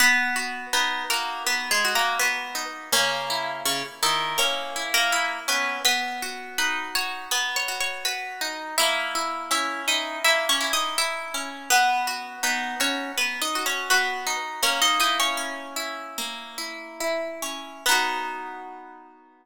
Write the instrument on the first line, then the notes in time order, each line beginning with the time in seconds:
orchestral harp
0.00 B3 B4
0.36 F#4
0.73 B3 D#4 B4
1.10 A#3 F#4 A#4
1.46 B3 B4
1.71 G#3 G#4
1.85 F#4
1.95 A#3 A#4
2.19 B3 F#4 B4
2.55 D#4
2.92 C#3 A#3 C#4
3.30 E4
3.65 C#3 C#4
4.03 D#3 D#4 E4
4.38 A#3 C#4 C#5
4.76 E4
4.94 A#3 A#4
5.12 E4
5.48 B3 C#4 B4
5.85 B3 B4 B5
6.22 F#4
6.58 D#4 B4 B5
6.95 F#4 C#5 C#6
7.31 B3 B4 B5
7.56 C#5 C#6
7.68 F#4
7.80 C#5 C#6
8.05 F#4 B4 B5
8.41 D#4
8.78 A#3 E4 E5
9.15 E4
9.51 C#4 E4 E5
9.88 D#4 E4 D#5
10.24 A#3 E4 E5
10.49 C#4 C#5
10.61 E4
10.73 D#4 D#5
10.98 E4 E5
11.34 C#4
11.70 B3 B4
12.07 F#4
12.43 B3 D#4 B4
12.80 C#4 F#4 C#5
13.18 B3 B4
13.42 D#4 D#5
13.55 F#4
13.66 C#4 C#5
13.90 B3 F#4 B4
14.27 D#4
14.63 A#3 C#4 C#5
14.82 D#4 D#5
15.00 D#4 E4 D#5
15.20 C#4 C#5
15.37 C#4
15.76 E4
16.18 A#3
16.58 E4
17.00 E4
17.42 C#4
17.86 B3 D#4 B4
17.91 F#4